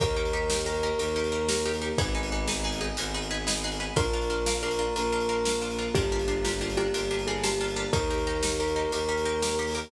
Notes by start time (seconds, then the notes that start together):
0.00 D#2 A#3 D#4 G4 A#4, kick, closed hi-hat
0.17 D#4 G4 A#4
0.25 closed hi-hat
0.33 D#4 G4 A#4
0.50 D#4 G4 A#4, snare
0.66 D#4 G4 A#4
0.74 closed hi-hat
0.83 D#4 G4 A#4
0.99 D#2 A#3 D#4 G4 A#4, closed hi-hat
1.16 D#4 G4 A#4
1.24 closed hi-hat
1.32 D#4 G4 A#4
1.49 D#4 G4 A#4, snare
1.65 D#4 G4 A#4
1.74 closed hi-hat
1.82 D#4 G4 A#4
1.98 G#1 B3 D#4 G#4 B4, kick, closed hi-hat
2.15 D#4 G#4 B4
2.23 closed hi-hat
2.32 D#4 G#4 B4
2.48 D#4 G#4 B4, snare
2.64 D#4 G#4 B4
2.72 closed hi-hat
2.81 D#4 G#4 B4
2.97 G#1 G#3 B3 D#4 G#4 B4, closed hi-hat
3.14 D#4 G#4 B4
3.22 closed hi-hat
3.31 D#4 G#4 B4
3.47 D#4 G#4 B4, snare
3.64 D#4 G#4 B4
3.72 closed hi-hat
3.80 D#4 G#4 B4
3.96 A#1 A#3 D4 F4 A#4, kick, closed hi-hat
4.13 D4 F4 A#4
4.21 closed hi-hat
4.30 D4 F4 A#4
4.46 D4 F4 A#4, snare
4.63 D4 F4 A#4
4.71 closed hi-hat
4.79 D4 F4 A#4
4.96 A#1 A#3 D4 F4 A#4, closed hi-hat
5.12 D4 F4 A#4
5.20 closed hi-hat
5.29 D4 F4 A#4
5.45 D4 F4 A#4, snare
5.62 D4 F4 A#4
5.70 closed hi-hat
5.79 D4 F4 A#4
5.95 G1 A#3 D4 F4 G4 A#4, kick, closed hi-hat
6.12 D4 F4 G4 A#4
6.19 closed hi-hat
6.28 D4 F4 G4 A#4
6.44 D4 F4 G4 A#4, snare
6.61 D4 F4 G4 A#4
6.70 closed hi-hat
6.77 D4 F4 G4 A#4
6.93 G1 A#3 D4 F4 G4 A#4, closed hi-hat
7.11 D4 F4 G4 A#4
7.19 closed hi-hat
7.27 D4 F4 G4 G#4 A#4
7.43 D4 F4 G4 A#4, snare
7.61 D4 F4 G4 A#4
7.68 closed hi-hat
7.76 D4 F4 G4 A#4
7.93 D#2 A#3 D#4 G4 A#4, kick, closed hi-hat
8.10 D#4 G4 A#4
8.18 closed hi-hat
8.27 D#4 G4 A#4
8.43 D#4 G4 A#4, snare
8.59 D#4 G4 A#4
8.68 closed hi-hat
8.76 D#4 G4 A#4
8.92 D#2 A#3 D#4 G4 A#4, closed hi-hat
9.09 D#4 G4 A#4
9.17 closed hi-hat
9.25 D#4 G4 A#4
9.42 D#4 G4 A#4, snare
9.59 D#4 G4 A#4
9.67 open hi-hat
9.75 D#4 G4 A#4